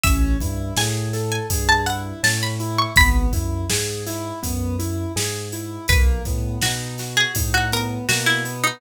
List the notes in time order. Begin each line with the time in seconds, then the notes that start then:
0.04 A1 C#4 E5, kick, closed hi-hat
0.40 G2 E4, kick, closed hi-hat
0.77 A2 G#4 G#5, snare
1.13 A4, snare, closed hi-hat
1.32 G#5
1.50 G2 G#4, kick, closed hi-hat
1.69 A5
1.86 E4 F#5, closed hi-hat
2.23 A2 C#4 A5, snare
2.43 B5
2.60 E4, closed hi-hat
2.79 C#6
2.96 G#1 B3 B5, kick, closed hi-hat
3.33 F#2 E4, kick, closed hi-hat
3.70 G#2 G#4, snare
4.07 E4, snare, closed hi-hat
4.43 F#2 B3, kick, closed hi-hat
4.79 E4, closed hi-hat
5.16 G#2 G#4, snare
5.52 E4, closed hi-hat
5.88 B1 A#3 B4, kick, closed hi-hat
6.25 A2 B3, kick, snare, closed hi-hat
6.62 B2 D#4 F#4, snare
6.98 F#4, snare, closed hi-hat
7.17 G#4
7.35 A2 D#4, kick, closed hi-hat
7.54 F#4
7.72 B3 A#4, closed hi-hat
8.09 B2 A#3 F#4, snare
8.26 E4
8.45 B3, closed hi-hat
8.64 D#4